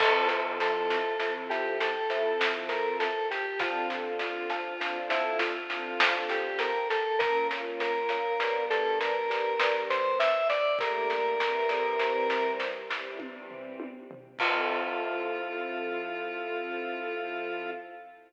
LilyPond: <<
  \new Staff \with { instrumentName = "Lead 1 (square)" } { \time 3/4 \key f \major \tempo 4 = 50 a'16 r16 a'8. g'16 a'8. bes'16 a'16 g'16 | f'16 r16 f'8. e'16 f'8. g'16 bes'16 a'16 | bes'16 r16 bes'8. a'16 bes'8. c''16 e''16 d''16 | bes'4. r4. |
f'2. | }
  \new Staff \with { instrumentName = "String Ensemble 1" } { \time 3/4 \key f \major <f c' e' a'>4 <f c' e' a'>8. <f c' e' a'>4~ <f c' e' a'>16 | <d c' f' a'>4 <d c' f' a'>8. <d c' f' a'>4~ <d c' f' a'>16 | <bes des' f'>4 <g b d'>8. <g b d'>4~ <g b d'>16 | <g a bes d'>8 <e g c'>4~ <e g c'>16 <e g c'>4~ <e g c'>16 |
<f c' e' a'>2. | }
  \new Staff \with { instrumentName = "Glockenspiel" } { \time 3/4 \key f \major <f' c'' e'' a''>8. <f' c'' e'' a''>16 <f' c'' e'' a''>16 <f' c'' e'' a''>8 <f' c'' e'' a''>16 <f' c'' e'' a''>4 | <d' c'' f'' a''>8. <d' c'' f'' a''>16 <d' c'' f'' a''>16 <d' c'' f'' a''>8 <d' c'' f'' a''>16 <d' c'' f'' a''>4 | <bes' des'' f''>8. <bes' des'' f''>16 <g' b' d''>16 <g' b' d''>8 <g' b' d''>16 <g' b' d''>4 | <g' a' bes' d''>8. <g' a' bes' d''>16 <e' g' c''>16 <e' g' c''>8 <e' g' c''>16 <e' g' c''>4 |
<f' c'' e'' a''>2. | }
  \new DrumStaff \with { instrumentName = "Drums" } \drummode { \time 3/4 <cymc bd sn>16 sn16 sn16 sn16 sn16 sn16 sn16 sn16 sn16 sn16 sn16 sn16 | <bd sn>16 sn16 sn16 sn16 sn16 sn16 sn16 sn16 sn16 sn16 sn16 sn16 | <bd sn>16 sn16 sn16 sn16 sn16 sn16 sn16 sn16 sn16 sn16 sn16 sn16 | <bd sn>16 sn16 sn16 sn16 sn16 sn16 sn16 sn16 <bd tommh>16 tomfh16 tommh16 tomfh16 |
<cymc bd>4 r4 r4 | }
>>